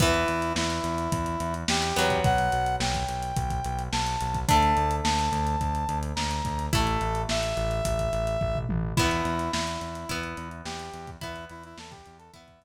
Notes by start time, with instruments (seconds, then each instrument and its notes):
0.00 synth bass 1 E2, acoustic guitar (steel) E3 B3, brass section E4, kick, closed hi-hat
0.14 closed hi-hat
0.28 synth bass 1 E2, closed hi-hat
0.42 closed hi-hat
0.55 synth bass 1 E2, brass section E4, snare
0.70 closed hi-hat
0.84 synth bass 1 E2, closed hi-hat
0.98 closed hi-hat
1.12 synth bass 1 E2, kick, closed hi-hat
1.26 closed hi-hat
1.40 synth bass 1 E2, closed hi-hat
1.54 closed hi-hat
1.68 synth bass 1 E2, brass section G4, snare
1.82 closed hi-hat
1.96 synth bass 1 E2, acoustic guitar (steel) F#3 B3, closed hi-hat
2.10 kick, closed hi-hat
2.24 synth bass 1 B1, brass section F#5, kick, closed hi-hat
2.38 closed hi-hat
2.52 synth bass 1 B1, closed hi-hat
2.66 closed hi-hat
2.80 synth bass 1 B1, brass section G5, snare
2.94 kick, closed hi-hat
3.08 synth bass 1 B1, closed hi-hat
3.23 closed hi-hat
3.36 synth bass 1 B1, kick, closed hi-hat
3.50 kick, closed hi-hat
3.64 synth bass 1 B1, closed hi-hat
3.79 closed hi-hat
3.92 synth bass 1 B1, brass section A5, snare
4.07 closed hi-hat
4.21 synth bass 1 B1, closed hi-hat
4.34 kick, closed hi-hat
4.49 synth bass 1 D2, acoustic guitar (steel) A3 D4, brass section A5, kick, closed hi-hat
4.63 closed hi-hat
4.77 synth bass 1 D2, closed hi-hat
4.91 closed hi-hat
5.03 synth bass 1 D2, brass section A5, snare
5.19 closed hi-hat
5.32 synth bass 1 D2, closed hi-hat
5.47 closed hi-hat
5.61 synth bass 1 D2, kick, closed hi-hat
5.75 closed hi-hat
5.89 synth bass 1 D2, closed hi-hat
6.03 closed hi-hat
6.16 synth bass 1 D2, brass section A#5, snare
6.31 closed hi-hat
6.45 synth bass 1 D2, kick, closed hi-hat
6.59 closed hi-hat
6.73 synth bass 1 A1, acoustic guitar (steel) A3 E4, brass section A4, kick, closed hi-hat
6.87 closed hi-hat
7.01 synth bass 1 A1, closed hi-hat
7.15 closed hi-hat
7.29 synth bass 1 A1, brass section E5, snare
7.43 closed hi-hat
7.57 synth bass 1 A1, closed hi-hat
7.71 closed hi-hat
7.85 synth bass 1 A1, kick, closed hi-hat
7.99 kick, closed hi-hat
8.13 synth bass 1 A1, closed hi-hat
8.27 closed hi-hat
8.41 synth bass 1 A1, kick, floor tom
8.55 mid tom
8.69 synth bass 1 A1, high tom
8.97 synth bass 1 E2, acoustic guitar (steel) B3 E4, brass section E4, kick, crash
9.11 closed hi-hat
9.25 synth bass 1 E2, closed hi-hat
9.39 closed hi-hat
9.52 synth bass 1 E2, brass section E4, snare
9.67 closed hi-hat
9.81 synth bass 1 E2, closed hi-hat
9.95 closed hi-hat
10.09 synth bass 1 E2, acoustic guitar (steel) B3 E4, kick, closed hi-hat
10.23 closed hi-hat
10.37 synth bass 1 E2, closed hi-hat
10.51 closed hi-hat
10.65 synth bass 1 E2, brass section G4, snare
10.79 closed hi-hat
10.93 synth bass 1 E2, closed hi-hat
11.07 kick, closed hi-hat
11.21 synth bass 1 E2, acoustic guitar (steel) B3 E4, brass section E4, kick, closed hi-hat
11.36 closed hi-hat
11.49 synth bass 1 E2, brass section E4, closed hi-hat
11.63 brass section E4, closed hi-hat
11.77 synth bass 1 E2, brass section A4, snare
11.91 brass section G4, kick, closed hi-hat
12.06 synth bass 1 E2, closed hi-hat
12.18 brass section A4, closed hi-hat
12.33 synth bass 1 E2, acoustic guitar (steel) B3 E4, brass section E5, kick, closed hi-hat
12.48 kick, closed hi-hat
12.61 synth bass 1 E2, closed hi-hat